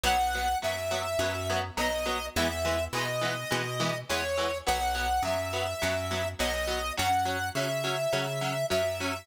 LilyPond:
<<
  \new Staff \with { instrumentName = "Lead 1 (square)" } { \time 4/4 \key fis \mixolydian \tempo 4 = 104 fis''4 e''2 dis''4 | e''4 dis''2 cis''4 | fis''4 e''2 dis''4 | fis''4 e''2 e''4 | }
  \new Staff \with { instrumentName = "Overdriven Guitar" } { \time 4/4 \key fis \mixolydian <fis b>8 <fis b>8 <fis b>8 <fis b>8 <fis b>8 <fis b>8 <fis b>8 <fis b>8 | <e gis b>8 <e gis b>8 <e gis b>8 <e gis b>8 <e gis b>8 <e gis b>8 <e gis b>8 <e gis b>8 | <fis b>8 <fis b>8 <fis b>8 <fis b>8 <fis b>8 <fis b>8 <fis b>8 <fis b>8 | <fis cis'>8 <fis cis'>8 <fis cis'>8 <fis cis'>8 <fis cis'>8 <fis cis'>8 <fis cis'>8 <fis cis'>8 | }
  \new Staff \with { instrumentName = "Electric Bass (finger)" } { \clef bass \time 4/4 \key fis \mixolydian b,,4 fis,4 fis,4 b,,4 | e,4 b,4 b,4 e,4 | b,,4 fis,4 fis,4 b,,4 | fis,4 cis4 cis4 fis,4 | }
>>